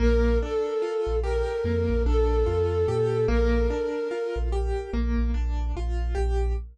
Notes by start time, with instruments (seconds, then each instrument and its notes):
0.00 synth bass 2 A#1, acoustic grand piano A#3, flute A#4
0.41 acoustic grand piano D4, flute A4
0.82 acoustic grand piano F4
1.06 synth bass 2 A#1
1.23 acoustic grand piano G4, flute A#4
1.64 synth bass 2 F2, acoustic grand piano A#3
1.89 synth bass 2 A#1
2.05 synth bass 2 A#1, acoustic grand piano D4, flute A4
2.46 synth bass 2 F2, acoustic grand piano F4
2.88 synth bass 2 A#2, acoustic grand piano G4
3.28 synth bass 2 A#1, acoustic grand piano A#3, flute A#4
3.70 acoustic grand piano D4
4.11 acoustic grand piano F4
4.36 synth bass 2 A#1
4.52 acoustic grand piano G4
4.93 synth bass 2 A#1, acoustic grand piano A#3
5.18 synth bass 2 A#1
5.34 synth bass 2 A#1, acoustic grand piano D4
5.76 synth bass 2 A#1, acoustic grand piano F4
6.15 synth bass 2 A#1, acoustic grand piano G4